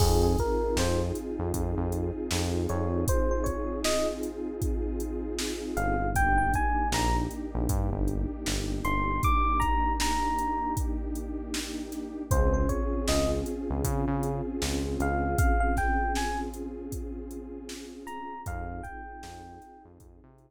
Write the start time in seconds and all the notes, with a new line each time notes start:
0.00 F2 C4 D#4 F4 G#4, kick, crash
0.23 G#4
0.38 A#4, kick, closed hi-hat
0.77 F2 C5, snare
1.15 closed hi-hat
1.39 F2
1.54 F2, kick, closed hi-hat
1.77 F2
1.92 closed hi-hat
2.31 F2, snare
2.69 F2 C#5, closed hi-hat
3.08 C5, kick, closed hi-hat
3.31 C5
3.44 C#5, kick, closed hi-hat
3.84 D#5, snare
4.23 closed hi-hat
4.62 kick, closed hi-hat
5.00 closed hi-hat
5.39 snare
5.77 G1 F5, closed hi-hat
6.15 A#3 D4 D#4 G4 G5, kick, closed hi-hat
6.38 G5
6.54 G#5, kick, closed hi-hat
6.92 A#1 A#5, snare
7.31 closed hi-hat
7.55 A#1
7.69 G2, kick, closed hi-hat
7.92 G1
8.08 closed hi-hat
8.46 G1, snare
8.84 G1 C6, closed hi-hat
9.23 D6, kick, closed hi-hat
9.60 A#5, kick, closed hi-hat
10.00 A#5, snare
10.38 closed hi-hat
10.77 kick, closed hi-hat
11.15 closed hi-hat
11.54 snare
11.92 snare, closed hi-hat
12.31 C#2 C4 C#4 F4 G#4 C5, kick, closed hi-hat
12.54 C5
12.69 C#5, kick, closed hi-hat
13.08 C#2 D#5, snare
13.46 closed hi-hat
13.70 C#2
13.84 C#3, kick, closed hi-hat
14.08 C#3
14.23 closed hi-hat
14.62 C#2, snare
15.00 C#2 F5, closed hi-hat
15.38 F5, kick, closed hi-hat
15.60 F5
15.77 G5, kick, snare, closed hi-hat
16.15 G#5, snare
16.54 closed hi-hat
16.92 kick, closed hi-hat
17.31 closed hi-hat
17.69 snare
18.07 A#5, closed hi-hat
18.46 F2 C4 D#4 F4 G#4 F5, kick, closed hi-hat
18.83 G5, kick, closed hi-hat
19.23 F2, snare
19.62 snare, closed hi-hat
19.85 F2
20.00 F2, kick, closed hi-hat
20.24 C3
20.38 closed hi-hat